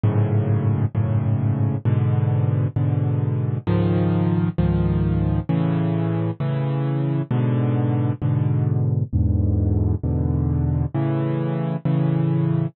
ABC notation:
X:1
M:6/8
L:1/8
Q:3/8=66
K:A
V:1 name="Acoustic Grand Piano" clef=bass
[F,,G,,A,,C,]3 [F,,G,,A,,C,]3 | [G,,B,,D,]3 [G,,B,,D,]3 | [C,,G,,^D,^E,]3 [C,,G,,D,E,]3 | [A,,C,E,]3 [A,,C,E,]3 |
[G,,B,,D,]3 [G,,B,,D,]3 | [E,,G,,B,,D,]3 [E,,G,,B,,D,]3 | [A,,C,E,]3 [A,,C,E,]3 |]